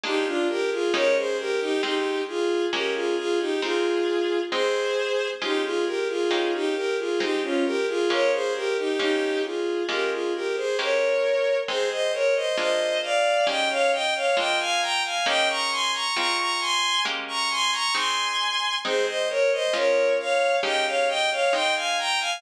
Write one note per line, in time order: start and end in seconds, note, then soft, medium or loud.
0.04 0.84 G#3 medium
0.04 0.84 A#3 medium
0.04 0.84 D4 medium
0.04 0.26 D#4 medium
0.04 0.84 F4 medium
0.04 0.26 G4 loud
0.26 0.47 D4 medium
0.26 0.47 F4 medium
0.49 0.70 G4 medium
0.49 0.70 A#4 loud
0.71 0.93 F4 medium
0.71 0.93 G#4 medium
0.93 1.74 G#3 loud
0.93 1.74 A#3 medium
0.93 1.74 C#4 medium
0.93 1.74 D#4 loud
0.93 1.74 G4 medium
0.93 1.15 A#4 loud
0.93 1.15 C#5 loud
1.16 1.37 G#4 medium
1.16 1.37 C5 medium
1.39 1.60 G4 medium
1.39 1.60 A#4 loud
1.60 1.81 D#4 medium
1.60 1.81 G4 loud
1.83 2.64 G#3 medium
1.83 2.64 C4 medium
1.83 2.22 D#4 medium
1.83 2.64 F4 loud
1.83 2.22 G4 medium
2.28 2.66 F4 medium
2.28 2.66 G#4 medium
2.72 3.53 G#3 medium
2.72 3.53 A#3 medium
2.72 3.53 C#4 loud
2.72 2.94 G4 medium
2.72 3.53 G4 loud
2.72 2.94 A#4 medium
2.94 3.16 F4 medium
2.94 3.16 G#4 medium
3.17 3.38 F4 medium
3.17 3.38 G#4 loud
3.39 3.60 D#4 medium
3.39 3.60 G4 medium
3.62 4.43 G#3 medium
3.62 4.43 C4 medium
3.62 4.43 D#4 loud
3.62 4.40 F4 medium
3.62 4.40 G#4 loud
4.51 5.33 G#3 loud
4.51 5.33 C4 loud
4.51 5.33 D#4 medium
4.51 5.28 G#4 loud
4.51 5.28 C5 loud
5.42 6.22 G#3 loud
5.42 6.22 C#4 medium
5.42 5.63 D#4 medium
5.42 6.22 F4 medium
5.42 5.63 G4 loud
5.63 5.85 F4 medium
5.63 5.85 G#4 medium
5.86 6.07 G4 medium
5.86 6.07 A#4 medium
6.08 6.52 F4 medium
6.08 6.52 G#4 medium
6.31 7.11 G#3 medium
6.31 7.11 A#3 medium
6.31 7.11 C#4 medium
6.31 7.11 D#4 medium
6.31 7.11 G4 loud
6.54 6.75 D#4 medium
6.54 6.75 G4 loud
6.75 6.97 G4 medium
6.75 6.97 A#4 medium
6.98 7.19 F4 medium
6.98 7.19 G#4 medium
7.20 8.01 G#3 loud
7.20 8.01 C4 loud
7.20 7.41 D#4 medium
7.20 8.01 D#4 medium
7.20 7.41 G4 medium
7.43 7.64 C#4 medium
7.43 7.64 F4 medium
7.65 7.86 G4 medium
7.65 7.86 A#4 loud
7.88 8.09 F4 medium
7.88 8.09 G#4 loud
8.10 8.91 G#3 medium
8.10 8.91 A#3 loud
8.10 8.91 C#4 medium
8.10 8.91 F4 medium
8.10 8.31 A#4 medium
8.10 8.31 C#5 loud
8.32 8.53 G#4 medium
8.32 8.53 C5 loud
8.55 8.76 G4 medium
8.55 8.76 A#4 loud
8.77 8.99 D#4 medium
8.77 8.99 G4 medium
8.99 9.80 G#3 medium
8.99 9.80 A#3 medium
8.99 9.80 C#4 medium
8.99 9.80 D#4 medium
8.99 9.42 D#4 medium
8.99 9.80 G4 medium
8.99 9.42 G4 loud
9.44 9.83 F4 medium
9.44 9.83 G#4 medium
9.89 10.69 G#3 medium
9.89 10.69 A#3 loud
9.89 10.69 C#4 medium
9.89 10.69 F4 medium
9.89 10.10 G4 medium
9.89 10.10 A#4 medium
10.11 10.32 F4 medium
10.11 10.32 G#4 medium
10.34 10.56 G4 medium
10.34 10.56 A#4 medium
10.56 10.77 G#4 medium
10.56 10.77 C5 medium
10.79 11.60 G#3 medium
10.79 11.60 A#3 loud
10.79 11.60 C#4 medium
10.79 11.60 G4 loud
10.79 11.57 A#4 medium
10.79 11.57 C#5 medium
11.68 12.49 G#3 loud
11.68 12.49 C4 loud
11.68 12.49 D#4 medium
11.68 11.89 G#4 loud
11.68 11.89 C5 loud
11.91 12.12 C5 medium
11.91 12.12 D#5 loud
12.13 12.34 A#4 medium
12.13 12.34 C#5 loud
12.35 12.56 C5 medium
12.35 12.56 D#5 loud
12.57 13.38 G#3 medium
12.57 13.38 A#3 loud
12.57 13.38 D4 medium
12.57 13.38 F4 loud
12.57 12.99 C5 loud
12.57 12.99 D#5 loud
13.03 13.45 D5 medium
13.03 13.45 F5 loud
13.47 14.27 G#3 loud
13.47 14.27 A#3 medium
13.47 14.27 C#4 loud
13.47 14.27 D#4 medium
13.47 14.27 G4 medium
13.47 13.69 D#5 medium
13.47 13.69 G5 loud
13.69 13.91 C#5 medium
13.69 13.91 F5 loud
13.92 14.13 D#5 medium
13.92 14.13 G5 loud
14.15 14.36 C#5 medium
14.15 14.36 F5 medium
14.37 15.17 G#3 medium
14.37 15.17 A#3 medium
14.37 15.17 D4 loud
14.37 15.17 F4 loud
14.37 14.58 D#5 medium
14.37 14.58 G5 loud
14.60 14.81 F5 loud
14.60 14.81 G#5 loud
14.81 15.02 G5 medium
14.81 15.02 A#5 loud
15.04 15.25 F5 medium
15.04 15.25 G#5 medium
15.26 16.07 G#3 loud
15.26 16.07 A#3 loud
15.26 16.07 C#4 loud
15.26 16.07 D#4 loud
15.26 16.07 G4 loud
15.26 15.48 D#5 loud
15.26 15.48 G5 loud
15.49 15.70 A#5 loud
15.49 15.70 C#6 loud
15.71 15.92 G#5 medium
15.71 15.92 C6 loud
15.93 16.15 A#5 medium
15.93 16.15 C#6 loud
16.15 16.97 G#3 medium
16.15 16.97 C4 loud
16.15 16.97 F4 medium
16.15 16.37 A#5 loud
16.15 16.37 C#6 loud
16.39 16.60 A#5 medium
16.39 16.60 C#6 loud
16.60 17.02 G#5 loud
16.60 17.02 C6 loud
17.05 17.86 G#3 loud
17.05 17.86 A#3 loud
17.05 17.86 C#4 loud
17.05 17.86 G4 loud
17.28 17.49 A#5 medium
17.28 17.49 C#6 loud
17.50 17.71 G#5 loud
17.50 17.71 C6 loud
17.72 17.93 A#5 loud
17.72 17.93 C#6 loud
17.95 18.75 G#3 loud
17.95 18.75 C4 loud
17.95 18.75 D#4 medium
17.95 18.75 G#5 medium
17.95 18.75 C6 medium
18.84 19.65 G#3 medium
18.84 19.65 C4 loud
18.84 19.65 D#4 loud
18.84 19.06 G#4 loud
18.84 19.06 C5 loud
19.07 19.28 C5 medium
19.07 19.28 D#5 loud
19.29 19.50 A#4 medium
19.29 19.50 C#5 loud
19.52 19.74 C5 loud
19.52 19.74 D#5 loud
19.74 20.54 G#3 loud
19.74 20.54 C#4 loud
19.74 20.54 F4 loud
19.74 20.14 A#4 medium
19.74 20.14 C#5 loud
20.19 20.56 C#5 medium
20.19 20.56 F5 loud
20.63 21.44 G#3 loud
20.63 21.44 A#3 medium
20.63 21.44 C#4 loud
20.63 21.44 D#4 medium
20.63 21.44 G4 loud
20.63 20.85 D#5 medium
20.63 20.85 G5 loud
20.86 21.07 C#5 medium
20.86 21.07 F5 medium
21.08 21.29 D#5 loud
21.08 21.29 G5 loud
21.31 21.52 C#5 medium
21.31 21.52 F5 loud
21.53 22.34 G#3 medium
21.53 22.34 C4 medium
21.53 22.34 D#4 loud
21.53 21.74 D#5 loud
21.53 21.74 G5 loud
21.75 21.97 F5 medium
21.75 21.97 G#5 loud
21.98 22.19 G5 medium
21.98 22.19 A#5 loud
22.20 22.41 F5 loud
22.20 22.41 G#5 loud